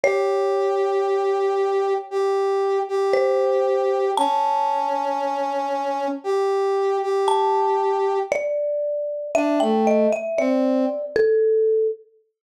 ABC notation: X:1
M:4/4
L:1/16
Q:1/4=58
K:A
V:1 name="Marimba"
c12 =c4 | a12 a4 | d4 e =g ^d e =d3 A3 z2 |]
V:2 name="Brass Section"
=G8 G3 G5 | C8 =G3 G5 | z4 D A,2 z =C2 z6 |]